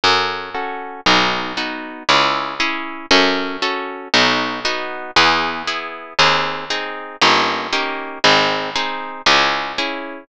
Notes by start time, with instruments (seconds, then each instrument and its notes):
0.04 harpsichord F#2, orchestral harp C#4 F#4 A4
0.54 orchestral harp C#4 F#4 A4
1.06 harpsichord B1, orchestral harp B3 D#4 F#4
1.57 orchestral harp B3 D#4 F#4
2.09 harpsichord C#2, orchestral harp C#4 E4 G#4
2.60 orchestral harp C#4 E4 G#4
3.11 harpsichord F#2, orchestral harp C#4 F#4 A4
3.62 orchestral harp C#4 F#4 A4
4.14 harpsichord B1, orchestral harp B3 D#4 F#4
4.65 orchestral harp B3 D#4 F#4
5.16 harpsichord E2, orchestral harp B3 E4 G#4
5.67 orchestral harp B3 E4 G#4
6.19 harpsichord D#2, orchestral harp C4 D#4 G#4
6.70 orchestral harp C4 D#4 G#4
7.21 harpsichord G1, orchestral harp A#3 C#4 D#4 G4
7.73 orchestral harp A#3 C#4 D#4 G4
8.24 harpsichord G#1, orchestral harp C4 D#4 G#4
8.76 orchestral harp C4 D#4 G#4
9.26 harpsichord C#2, orchestral harp C#4 E4 G#4
9.78 orchestral harp C#4 E4 G#4